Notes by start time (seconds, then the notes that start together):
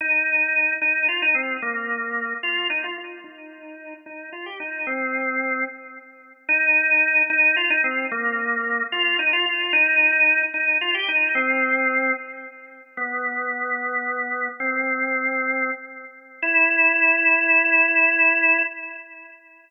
0.01 D#4
0.81 D#4
1.08 F4
1.22 D#4
1.35 C4
1.62 A#3
2.43 F4
2.70 D#4
2.84 F4
2.98 F4
3.24 D#4
4.06 D#4
4.32 F4
4.46 G4
4.60 D#4
4.87 C4
6.49 D#4
7.30 D#4
7.56 F4
7.70 D#4
7.84 C4
8.11 A#3
8.92 F4
9.19 D#4
9.33 F4
9.46 F4
9.73 D#4
10.54 D#4
10.81 F4
10.94 G4
11.08 D#4
11.35 C4
12.97 B3
14.60 C4
16.42 E4